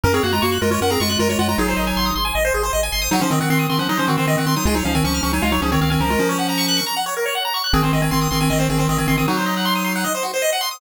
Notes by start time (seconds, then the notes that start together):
0.04 F#2 C#4 A#4
0.14 C4 G#4 C#5
0.23 F#2 A#3 F#4 F#5
0.33 G#3 F4 A#5
0.42 F#2 A#3 F#4 C#6
0.52 F#6
0.61 F#2 G#3 F4 A#4
0.71 G#3 F4 C#5
0.81 F#2 C#4 A#4 F#5
0.90 C4 G#4 A#5
1.00 F#2 G#3 F4 C#6
1.09 G#3 F4 F#6
1.19 F#2 G#3 F4 A#4
1.29 G#3 F4 C#5
1.39 F#2 G#3 F4 F#5
1.49 G#3 F4 A#5
1.58 G#1 F#3 D#4 G#4
1.68 C5
1.77 G#1 D#5
1.87 G#5
1.96 G#1 C6
2.06 D#6
2.16 G#1 C6
2.25 G#5
2.35 G#1 D#5
2.45 C5
2.54 G#1 G#4
2.63 C5
2.73 G#1 D#5
2.83 G#5
2.92 G#1 C6
3.02 D#6
3.11 F#3 D#4 F#4
3.21 F3 C#4 C5
3.30 D#3 C4 D#5
3.40 D#3 C4 F#5
3.50 D#3 C4 C6
3.59 D#6
3.69 D#3 C4 C6
3.79 F3 C#4 F#5
3.89 F#3 D#4 D#5
3.97 F3 C#4 C5
4.08 D#3 C4 F#4
4.17 D#3 C4 C5
4.27 D#3 C4 D#5
4.37 D#3 C4 F#5
4.46 D#3 C4 C6
4.56 F#3 D#4 D#6
4.65 C#2 G#3 F4 G#4
4.75 F#3 D#4 C#5
4.85 C#2 F3 C#4 F5
4.95 D#3 C4 G#5
5.04 C#2 F3 C#4 C#6
5.14 F6
5.23 C#2 F3 C#4 C#6
5.33 F#3 D#4 G#5
5.42 C#2 G#3 F4 F5
5.52 F#3 D#4 C#5
5.62 C#2 F3 C#4 G#4
5.72 D#3 C4 C#5
5.81 C#2 D#3 C4 F5
5.90 D#3 C4 G#5
6.00 C#2 F3 C#4 A#4
6.10 G#3 F4
6.19 F3 C#4
6.29 C#5
6.39 F#5
6.49 A#5
6.58 C#6
6.68 F#6
6.77 C#6
6.86 A#5
6.96 F#5
7.06 C#5
7.17 A#4
7.26 C#5
7.35 F#5
7.45 A#5
7.54 C#6
7.64 F#6
7.73 G#1 D#3 C4 G#4
7.83 D#3 C4 C5
7.93 G#1 D#3 C4 D#5
8.02 D#3 C4 G#5
8.11 G#1 D#3 C4 C6
8.21 D#6
8.31 G#1 D#3 C4 C6
8.41 D#3 C4 G#5
8.50 G#1 D#3 C4 D#5
8.59 D#3 C4 C5
8.69 G#1 D#3 C4 G#4
8.78 D#3 C4 C5
8.89 G#1 D#3 C4 D#5
8.98 D#3 C4 G#5
9.08 G#1 D#3 C4 C6
9.17 D#3 C4 D#6
9.28 F#3 D#4 F#4
9.37 C5
9.46 D#5
9.57 F#5
9.65 C6
9.75 D#6
9.84 C6
9.95 F#5
10.04 D#5
10.15 C5
10.23 F#4
10.34 C5
10.42 D#5
10.53 F#5
10.61 C6
10.71 D#6